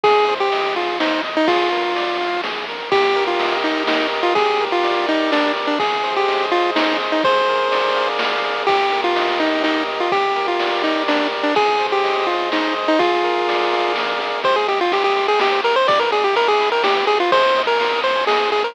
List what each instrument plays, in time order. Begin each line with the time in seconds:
0.04 synth bass 1 G#1, lead 1 (square) G#4, kick, ride
0.28 lead 1 (square) C5, ride
0.40 lead 1 (square) G4
0.52 lead 1 (square) D#5, ride
0.76 lead 1 (square) F4 G#4, ride
1.00 lead 1 (square) D#4 C5, snare
1.24 lead 1 (square) D#5, ride
1.37 lead 1 (square) D#4
1.48 synth bass 1 A#1, lead 1 (square) F4 G#4, kick, ride
1.72 lead 1 (square) A#4, ride
1.96 lead 1 (square) D5, ride
2.20 lead 1 (square) F5, ride
2.44 lead 1 (square) G#4, snare
2.68 lead 1 (square) A#4, ride
2.92 synth bass 1 D#2, lead 1 (square) G4, kick, ride
3.15 lead 1 (square) A#4, ride
3.27 lead 1 (square) F4
3.39 synth bass 1 D#2, lead 1 (square) D#5, ride
3.64 lead 1 (square) D#4 G4, ride
3.87 lead 1 (square) D#4 A#4, snare
4.12 lead 1 (square) D#5, ride
4.23 lead 1 (square) F4
4.35 synth bass 1 G1, lead 1 (square) G4 G#4, kick, ride
4.60 lead 1 (square) A#4, ride
4.72 lead 1 (square) F4
4.83 synth bass 1 G1, lead 1 (square) D5, ride
5.07 lead 1 (square) D#4 G4, ride
5.32 lead 1 (square) D4 A#4, snare
5.56 lead 1 (square) D5, ride
5.67 lead 1 (square) D4
5.79 synth bass 1 G#1, lead 1 (square) G#4, kick, ride
6.04 lead 1 (square) C5, ride
6.17 lead 1 (square) G4
6.28 synth bass 1 G#1, lead 1 (square) D#5, ride
6.52 lead 1 (square) F4 G#4, ride
6.76 lead 1 (square) D#4 C5, snare
7.00 lead 1 (square) D#5, ride
7.12 lead 1 (square) D#4
7.24 synth bass 1 A#1, lead 1 (square) G#4 C5, kick, ride
7.48 lead 1 (square) A#4, ride
7.72 synth bass 1 A#1, lead 1 (square) D5, ride
7.96 lead 1 (square) F5, ride
8.19 lead 1 (square) G#4, snare
8.44 lead 1 (square) A#4, ride
8.67 synth bass 1 D#2, lead 1 (square) G4, kick, ride
8.91 lead 1 (square) A#4, ride
9.04 lead 1 (square) F4
9.16 lead 1 (square) D#5, ride
9.39 lead 1 (square) D#4 G4, ride
9.64 lead 1 (square) D#4 A#4, snare
9.88 lead 1 (square) D#5, ride
10.00 lead 1 (square) F4
10.12 synth bass 1 G1, lead 1 (square) G4, kick, ride
10.36 lead 1 (square) A#4, ride
10.48 lead 1 (square) F4
10.60 lead 1 (square) D5, ride
10.84 lead 1 (square) D#4 G4, ride
11.08 lead 1 (square) D4 A#4, snare
11.32 lead 1 (square) D5, ride
11.43 lead 1 (square) D4
11.55 synth bass 1 G#1, lead 1 (square) G#4, kick, ride
11.80 lead 1 (square) C5, ride
11.92 lead 1 (square) G4
12.04 lead 1 (square) D#5, ride
12.27 lead 1 (square) F4 G#4, ride
12.52 lead 1 (square) D#4 C5, snare
12.76 lead 1 (square) D#5, ride
12.88 lead 1 (square) D#4
12.99 synth bass 1 A#1, lead 1 (square) F4 G#4, kick, ride
13.23 lead 1 (square) A#4, ride
13.48 lead 1 (square) D5, ride
13.72 lead 1 (square) F5, ride
13.96 lead 1 (square) G#4, snare
14.20 lead 1 (square) A#4, ride
14.44 synth bass 1 C2, lead 1 (square) G4 C5, kick, ride
14.56 lead 1 (square) G#4 C5
14.68 synth bass 1 C2, lead 1 (square) G4 D#5, ride
14.80 lead 1 (square) F4 G5
14.92 synth bass 1 C2, lead 1 (square) G4 C6, ride
15.04 lead 1 (square) G4 D#6
15.16 synth bass 1 C2, lead 1 (square) C6, ride
15.28 lead 1 (square) G#4 G5
15.40 synth bass 1 C2, lead 1 (square) G4 D#5, snare
15.52 lead 1 (square) C5
15.64 synth bass 1 C2, lead 1 (square) G4 A#4, ride
15.76 lead 1 (square) C5
15.88 synth bass 1 G1, lead 1 (square) G4 D5, kick, ride
16.00 lead 1 (square) A#4 B4
16.12 synth bass 1 G1, lead 1 (square) G#4 D5, ride
16.24 lead 1 (square) G4 G5
16.36 synth bass 1 G1, lead 1 (square) A#4 B5, ride
16.48 lead 1 (square) G#4 D6
16.60 synth bass 1 G1, lead 1 (square) B5, ride
16.72 lead 1 (square) A#4 G5
16.84 synth bass 1 G1, lead 1 (square) G4 D5, snare
16.96 lead 1 (square) B4
17.07 synth bass 1 G1, lead 1 (square) G4 G#4, ride
17.20 lead 1 (square) F4 B4
17.32 synth bass 1 D#2, lead 1 (square) G#4 C5, kick, ride
17.44 lead 1 (square) C5
17.56 synth bass 1 D#2, lead 1 (square) D#5, ride
17.67 lead 1 (square) A#4 G#5
17.80 synth bass 1 D#2, lead 1 (square) C6, ride
17.92 lead 1 (square) D#6
18.04 synth bass 1 D#2, lead 1 (square) C5 C6, ride
18.16 lead 1 (square) G#5
18.27 synth bass 1 D#2, lead 1 (square) G#4 D#5, snare
18.40 lead 1 (square) C5
18.52 synth bass 1 D#2, lead 1 (square) G#4, ride
18.64 lead 1 (square) A#4 C5